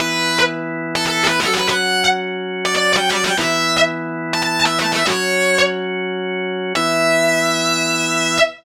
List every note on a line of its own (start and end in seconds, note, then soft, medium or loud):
0.00 1.40 E3 medium
0.00 1.40 B3 medium
0.00 1.40 E4 loud
0.00 0.38 B4 loud
0.95 1.05 A4 loud
1.06 1.23 A4 medium
1.27 1.40 B4 medium
1.40 1.53 A4 medium
1.48 3.35 F#3 medium
1.48 3.35 C#4 medium
1.48 3.35 F#4 loud
1.54 1.67 B4 loud
1.69 2.04 F#5 loud
2.65 2.74 D5 loud
2.75 2.92 D5 medium
2.96 3.09 G5 medium
3.11 3.24 D5 loud
3.24 3.37 G5 medium
3.37 5.04 E3 medium
3.37 5.04 B3 loud
3.37 5.04 E4 medium
3.37 3.76 E5 loud
4.33 4.42 A5 loud
4.42 4.59 A5 loud
4.65 4.79 E5 loud
4.79 4.93 A5 loud
4.92 5.05 E5 medium
5.07 6.73 F#3 loud
5.07 6.73 C#4 loud
5.07 6.73 F#4 loud
5.07 5.58 C#5 loud
6.75 8.39 E3 loud
6.75 8.39 B3 loud
6.75 8.39 E4 loud
6.75 8.37 E5 loud